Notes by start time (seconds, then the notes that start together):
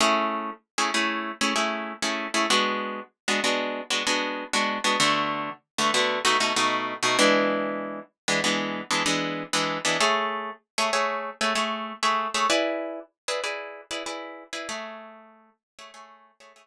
0.01 A3 C#4 E4 G#4
0.78 A3 C#4 E4 G#4
0.94 A3 C#4 E4 G#4
1.41 A3 C#4 E4 G#4
1.56 A3 C#4 E4 G#4
2.02 A3 C#4 E4 G#4
2.34 A3 C#4 E4 G#4
2.50 G#3 B3 D4 F#4
3.28 G#3 B3 D4 F#4
3.44 G#3 B3 D4 F#4
3.90 G#3 B3 D4 F#4
4.07 G#3 B3 D4 F#4
4.53 G#3 B3 D4 F#4
4.84 G#3 B3 D4 F#4
5.00 D3 A3 B3 F#4
5.78 D3 A3 B3 F#4
5.94 D3 A3 B3 F#4
6.25 B2 A3 D#4 F#4
6.40 B2 A3 D#4 F#4
6.56 B2 A3 D#4 F#4
7.03 B2 A3 D#4 F#4
7.19 E3 G#3 B3 D4
8.28 E3 G#3 B3 D4
8.44 E3 G#3 B3 D4
8.91 E3 G#3 B3 D4
9.06 E3 G#3 B3 D4
9.53 E3 G#3 B3 D4
9.85 E3 G#3 B3 D4
10.01 A3 G#4 C#5 E5
10.78 A3 G#4 C#5 E5
10.93 A3 G#4 C#5 E5
11.41 A3 G#4 C#5 E5
11.55 A3 G#4 C#5 E5
12.03 A3 G#4 C#5 E5
12.34 A3 G#4 C#5 E5
12.50 E4 G#4 B4 D5
13.28 E4 G#4 B4 D5
13.44 E4 G#4 B4 D5
13.91 E4 G#4 B4 D5
14.06 E4 G#4 B4 D5
14.53 E4 G#4 B4 D5
14.69 A3 G#4 C#5 E5
15.79 A3 G#4 C#5 E5
15.94 A3 G#4 C#5 E5
16.40 A3 G#4 C#5 E5
16.56 A3 G#4 C#5 E5